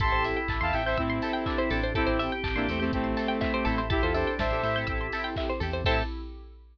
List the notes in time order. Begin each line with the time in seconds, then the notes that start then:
0.00 A1 C4 E4 G4 A4 A5 C6, kick, closed hi-hat
0.12 A1 C5
0.24 E5, open hi-hat
0.36 G5
0.48 A1 A5, kick, clap
0.61 E2 C4 E4 G4 A4 F5 A5 C6
0.73 A1 C4 E4 G4 A4 E5 G5 E6, open hi-hat
0.85 C4 E4 G4 A4 C5 E5 G6
0.97 A2 C4 E4 G4 A4 E6, kick, closed hi-hat
1.10 C6
1.22 C4 E4 G4 A4 A5, open hi-hat
1.33 G5
1.46 D4 E5, kick, clap
1.58 E4 C5
1.70 A1 C4 D4 E4 G4 A4, open hi-hat
1.83 C5
1.95 C4 E4 G4 A4, kick, closed hi-hat
2.07 A1 C5
2.19 E5, open hi-hat
2.32 G5
2.44 A1 A5, kick, clap
2.55 A1 A#3 C4 D4 E4 G4 A4 C6
2.68 E2 A3 C4 E4 G4 A4 E6, open hi-hat
2.80 A3 C4 E4 G4 A4 G6
2.92 A1 A3 C4 E4 G4 A4 E6, kick, closed hi-hat
3.04 C6
3.17 C4 E4 G4 A4 A5, open hi-hat
3.28 G5
3.41 E4 E5, kick, clap
3.54 G4 C5
3.65 A1 C4 E4 G4 A4, open hi-hat
3.78 C5
3.90 C4 E4 G4 A4, kick, closed hi-hat
4.02 E2 F4 A4 C5
4.14 D4 A4 C5 E5, open hi-hat
4.27 G5
4.39 A1 C5 E5 A5, kick, snare
4.50 A1 C4 E4 G4 A4 C6
4.63 A2 C4 E4 G4 A4 E6, open hi-hat
4.76 C4 E4 G4 A4 G6
4.87 A1 C4 E4 G4 A4 E6, kick, closed hi-hat
5.01 C6
5.12 C4 E4 G4 A4 A5, open hi-hat
5.24 G5
5.36 E5, kick, clap
5.49 C5
5.60 E2 C4 E4 G4 A4, open hi-hat
5.73 C5
5.85 A2 C4 E4 G4 A4 C5 E5 G5 A5, kick, crash